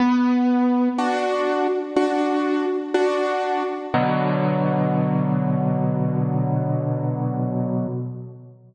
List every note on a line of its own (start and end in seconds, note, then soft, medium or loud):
0.00 0.89 B3 loud
0.98 1.67 D4 medium
0.98 1.67 F#4 loud
1.96 2.65 D4 medium
1.96 2.65 F#4 loud
2.94 3.63 D4 medium
2.94 3.63 F#4 medium
3.94 7.86 B2 loud
3.94 7.86 D3 medium
3.94 7.86 F#3 loud